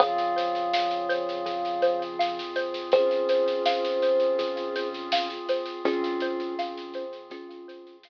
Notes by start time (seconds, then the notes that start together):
0.00 F2 C#3 F3 C4 F4 G#4 C#5 F5, kick, snare
0.18 snare
0.36 C5, snare
0.55 snare
0.73 F5, snare
0.91 snare
1.09 C5, snare
1.29 snare
1.46 G#4, kick, snare
1.65 snare
1.82 C5, snare
2.02 snare
2.19 F5, snare
2.39 snare
2.56 C5, snare
2.74 snare
2.92 C#4 F4 G#4 C5, kick, snare
3.11 snare
3.29 C5, snare
3.48 snare
3.66 F5, snare
3.85 snare
4.02 C5, snare
4.20 snare
4.39 G#4, kick, snare
4.57 snare
4.76 C5, snare
4.94 snare
5.12 F5, snare
5.30 snare
5.49 C5, snare
5.66 snare
5.85 F2 C4 C#4 F4 G#4, kick, snare
6.04 snare
6.20 C5, snare
6.40 snare
6.59 F5, snare
6.77 snare
6.94 C5, snare
7.13 snare
7.30 C#4 F4 G#4, kick, snare
7.50 snare
7.68 C5, snare
7.87 snare
8.03 F5, snare